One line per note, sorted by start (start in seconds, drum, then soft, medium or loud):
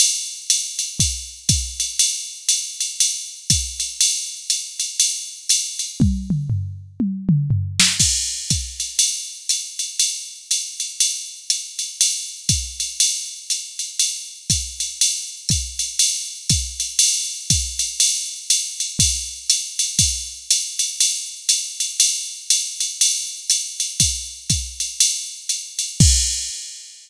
0.00 ride loud
0.50 hi-hat pedal medium
0.50 ride loud
0.79 ride medium
0.99 kick medium
0.99 ride medium
1.49 kick medium
1.49 hi-hat pedal medium
1.49 ride medium
1.80 ride medium
1.99 ride loud
2.49 hi-hat pedal medium
2.49 ride medium
2.81 ride medium
3.00 ride loud
3.50 kick medium
3.50 hi-hat pedal medium
3.50 ride medium
3.80 ride medium
4.01 ride loud
4.50 hi-hat pedal medium
4.50 ride medium
4.80 ride medium
5.00 ride loud
5.49 hi-hat pedal medium
5.49 ride loud
5.79 ride medium
6.00 kick medium
6.00 high tom medium
6.30 mid tom medium
6.50 floor tom medium
7.00 high tom medium
7.29 mid tom loud
7.51 floor tom medium
7.80 snare loud
8.00 kick medium
8.00 crash medium
8.00 ride medium
8.50 kick medium
8.50 hi-hat pedal medium
8.50 ride medium
8.80 ride medium
8.99 ride loud
9.49 hi-hat pedal medium
9.49 ride medium
9.79 ride medium
9.99 ride medium
10.51 hi-hat pedal medium
10.51 ride medium
10.80 ride medium
11.00 ride loud
11.50 hi-hat pedal medium
11.50 ride medium
11.79 ride medium
12.01 ride loud
12.49 kick medium
12.49 hi-hat pedal medium
12.49 ride medium
12.80 ride medium
13.00 ride loud
13.50 hi-hat pedal medium
13.50 ride medium
13.79 ride medium
13.99 ride medium
14.50 kick medium
14.50 hi-hat pedal medium
14.50 ride medium
14.80 ride medium
15.01 ride loud
15.49 kick medium
15.49 hi-hat pedal medium
15.49 ride medium
15.79 ride medium
15.99 ride loud
16.49 kick medium
16.49 hi-hat pedal medium
16.49 ride medium
16.80 ride medium
16.99 ride loud
17.50 kick medium
17.50 hi-hat pedal medium
17.50 ride loud
17.79 ride medium
18.00 ride loud
18.50 hi-hat pedal medium
18.50 ride loud
18.80 ride medium
18.99 kick medium
18.99 ride loud
19.50 hi-hat pedal loud
19.50 ride medium
19.79 ride medium
19.99 kick medium
19.99 ride loud
20.51 hi-hat pedal loud
20.51 ride loud
20.79 ride medium
21.00 ride loud
21.49 hi-hat pedal medium
21.49 ride medium
21.80 ride medium
22.00 ride loud
22.50 hi-hat pedal medium
22.50 ride loud
22.80 ride medium
23.01 ride loud
23.50 hi-hat pedal medium
23.50 ride medium
23.80 ride medium
24.00 kick medium
24.00 ride loud
24.50 kick medium
24.50 hi-hat pedal medium
24.50 ride medium
24.80 ride medium
25.00 ride loud
25.49 hi-hat pedal medium
25.49 ride medium
25.79 ride medium
26.00 kick loud
26.00 crash loud